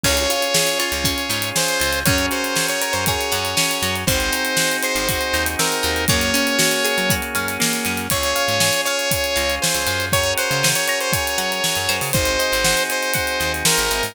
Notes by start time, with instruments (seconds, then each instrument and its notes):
0.04 electric bass (finger) C#2, drawbar organ C#4 F4 G#4, acoustic guitar (steel) C#4, lead 2 (sawtooth) C#5, kick, crash
0.17 closed hi-hat
0.30 acoustic guitar (steel) F4, closed hi-hat
0.42 closed hi-hat
0.54 acoustic guitar (steel) G#4, snare
0.67 closed hi-hat
0.79 acoustic guitar (steel) F4, lead 2 (sawtooth) C#5, closed hi-hat
0.92 electric bass (finger) C#2, closed hi-hat
1.04 acoustic guitar (steel) C#4, kick, closed hi-hat
1.18 closed hi-hat
1.30 electric bass (finger) G#2, acoustic guitar (steel) F4, closed hi-hat
1.42 closed hi-hat
1.56 acoustic guitar (steel) G#4, lead 2 (sawtooth) C5, snare
1.68 closed hi-hat
1.80 electric bass (finger) C#2, acoustic guitar (steel) F4, closed hi-hat
1.93 closed hi-hat
2.05 electric bass (finger) F#2, drawbar organ C#4 F#4 G#4 A#4, acoustic guitar (steel) C#4, lead 2 (sawtooth) C#5, kick, closed hi-hat
2.18 closed hi-hat
2.31 acoustic guitar (steel) F#4, lead 2 (sawtooth) C5, closed hi-hat
2.44 closed hi-hat
2.56 acoustic guitar (steel) G#4, snare
2.68 lead 2 (sawtooth) C#5, closed hi-hat
2.82 acoustic guitar (steel) A#4, lead 2 (sawtooth) C#5, closed hi-hat
2.93 electric bass (finger) F#2, lead 2 (sawtooth) C5, closed hi-hat
3.06 acoustic guitar (steel) G#4, lead 2 (sawtooth) C#5, kick, closed hi-hat
3.21 closed hi-hat
3.32 electric bass (finger) F#2, acoustic guitar (steel) F#4, closed hi-hat
3.45 closed hi-hat
3.57 acoustic guitar (steel) C#4, snare
3.71 closed hi-hat
3.82 electric bass (finger) F#2, acoustic guitar (steel) F#4, closed hi-hat
3.96 closed hi-hat
4.07 electric bass (finger) G#1, drawbar organ C4 D#4 F#4 G#4, acoustic guitar (steel) C4, lead 2 (sawtooth) C5, kick, closed hi-hat
4.20 closed hi-hat
4.32 acoustic guitar (steel) D#4, closed hi-hat
4.45 closed hi-hat
4.57 acoustic guitar (steel) F#4, snare
4.71 closed hi-hat
4.83 acoustic guitar (steel) G#4, lead 2 (sawtooth) C5, closed hi-hat
4.95 electric bass (finger) G#1, closed hi-hat
5.09 acoustic guitar (steel) F#4, kick, closed hi-hat
5.21 closed hi-hat
5.33 electric bass (finger) D#2, acoustic guitar (steel) D#4, closed hi-hat
5.46 closed hi-hat
5.59 acoustic guitar (steel) C4, lead 2 (sawtooth) A#4, snare
5.72 closed hi-hat
5.83 electric bass (finger) D#2, acoustic guitar (steel) D#4, closed hi-hat
5.96 closed hi-hat
6.08 electric bass (finger) F#2, drawbar organ A#3 C#4 F#4 G#4, acoustic guitar (steel) A#3, lead 2 (sawtooth) C#5, kick, closed hi-hat
6.21 closed hi-hat
6.34 acoustic guitar (steel) C#4, closed hi-hat
6.47 closed hi-hat
6.59 acoustic guitar (steel) F#4, snare
6.71 closed hi-hat
6.84 acoustic guitar (steel) G#4, closed hi-hat
6.98 electric bass (finger) F#3, closed hi-hat
7.10 acoustic guitar (steel) F#4, kick, closed hi-hat
7.22 closed hi-hat
7.35 electric bass (finger) F#2, acoustic guitar (steel) C#4, closed hi-hat
7.48 closed hi-hat
7.60 acoustic guitar (steel) A#3, snare
7.73 closed hi-hat
7.85 electric bass (finger) F#2, acoustic guitar (steel) C#4, closed hi-hat
7.97 closed hi-hat
8.10 electric bass (finger) C#2, drawbar organ C#4 F4 G#4, acoustic guitar (steel) C#5, lead 2 (sawtooth) C#5, kick, closed hi-hat
8.23 closed hi-hat
8.36 acoustic guitar (steel) F5, closed hi-hat
8.48 electric bass (finger) G#2, closed hi-hat
8.60 acoustic guitar (steel) G#5, snare
8.73 closed hi-hat
8.85 lead 2 (sawtooth) C#5, acoustic guitar (steel) F5, closed hi-hat
8.99 closed hi-hat
9.11 acoustic guitar (steel) C#5, kick, closed hi-hat
9.24 closed hi-hat
9.36 electric bass (finger) C#2, acoustic guitar (steel) F5, closed hi-hat
9.50 closed hi-hat
9.62 lead 2 (sawtooth) C5, acoustic guitar (steel) G#5, snare
9.75 electric bass (finger) C#2, closed hi-hat
9.87 electric bass (finger) F#2, acoustic guitar (steel) F5, closed hi-hat
10.00 closed hi-hat
10.12 drawbar organ C#4 F#4 G#4 A#4, lead 2 (sawtooth) C#5, acoustic guitar (steel) C#5, kick, closed hi-hat
10.24 closed hi-hat
10.38 lead 2 (sawtooth) C5, acoustic guitar (steel) F#5, closed hi-hat
10.51 electric bass (finger) C#3, closed hi-hat
10.63 acoustic guitar (steel) G#5, snare
10.75 lead 2 (sawtooth) C#5, closed hi-hat
10.88 lead 2 (sawtooth) C#5, acoustic guitar (steel) A#5, closed hi-hat
11.01 lead 2 (sawtooth) C5, closed hi-hat
11.13 lead 2 (sawtooth) C#5, acoustic guitar (steel) G#5, kick, closed hi-hat
11.27 closed hi-hat
11.38 electric bass (finger) F#3, acoustic guitar (steel) F#5, closed hi-hat
11.52 closed hi-hat
11.64 acoustic guitar (steel) C#5, snare
11.75 electric bass (finger) F#2, closed hi-hat
11.89 electric bass (finger) F#2, acoustic guitar (steel) C5, closed hi-hat
12.01 electric bass (finger) C#3, open hi-hat
12.13 electric bass (finger) G#1, drawbar organ C4 D#4 F#4 G#4, lead 2 (sawtooth) C5, kick, closed hi-hat
12.25 closed hi-hat
12.39 acoustic guitar (steel) D#5, closed hi-hat
12.52 electric bass (finger) G#1, closed hi-hat
12.64 acoustic guitar (steel) F#5, snare
12.77 closed hi-hat
12.90 lead 2 (sawtooth) C5, acoustic guitar (steel) G#5, closed hi-hat
13.03 closed hi-hat
13.14 acoustic guitar (steel) F#5, kick, closed hi-hat
13.27 closed hi-hat
13.40 electric bass (finger) D#2, acoustic guitar (steel) D#5, closed hi-hat
13.54 closed hi-hat
13.65 lead 2 (sawtooth) A#4, acoustic guitar (steel) C5, snare
13.77 electric bass (finger) G#1, closed hi-hat
13.91 electric bass (finger) G#1, acoustic guitar (steel) E5, closed hi-hat
14.03 electric bass (finger) G#2, open hi-hat